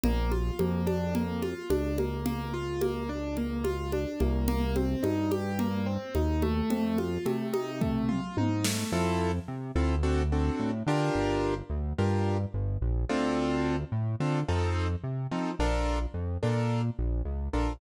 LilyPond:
<<
  \new Staff \with { instrumentName = "Acoustic Grand Piano" } { \time 4/4 \key bes \major \tempo 4 = 108 bes8 f'8 bes8 d'8 bes8 f'8 d'8 bes8 | bes8 f'8 bes8 d'8 bes8 f'8 d'8 bes8 | bes8 c'8 ees'8 g'8 bes8 c'8 ees'8 a8~ | a8 f'8 a8 ees'8 a8 f'8 ees'8 a8 |
\key f \major <c' e' f' a'>4. <c' e' f' a'>8 <c' d' fis' a'>8 <c' d' fis' a'>4 <d' f' g' bes'>8~ | <d' f' g' bes'>4. <d' f' g' bes'>2 <c' d' f' a'>8~ | <c' d' f' a'>4. <c' d' f' a'>8 <c' ees' f' a'>4. <c' ees' f' a'>8 | <d' f' a' bes'>4. <d' f' a' bes'>2 <d' f' a' bes'>8 | }
  \new Staff \with { instrumentName = "Synth Bass 1" } { \clef bass \time 4/4 \key bes \major bes,,4 f,2 des,4~ | des,2.~ des,8 c,8~ | c,4 g,2 ees,4 | f,4 c2 aes,4 |
\key f \major f,4 c8 d,4. a,8 d8 | g,,4 d,8 g,4 g,,8 bes,,8 d,8~ | d,4 a,8 d8 f,4 c8 f8 | bes,,4 f,8 bes,4 bes,,8 des,8 bes,,8 | }
  \new DrumStaff \with { instrumentName = "Drums" } \drummode { \time 4/4 cgl8 cgho8 cgho8 cgho8 cgl8 cgho8 cgho8 cgho8 | cgl4 cgho4 cgl8 cgho8 cgho8 cgho8 | cgl8 cgho8 cgho8 cgho8 cgl4 cgho8 cgho8 | cgl8 cgho8 cgho8 cgho8 <bd tomfh>8 toml8 tommh8 sn8 |
r4 r4 r4 r4 | r4 r4 r4 r4 | r4 r4 r4 r4 | r4 r4 r4 r4 | }
>>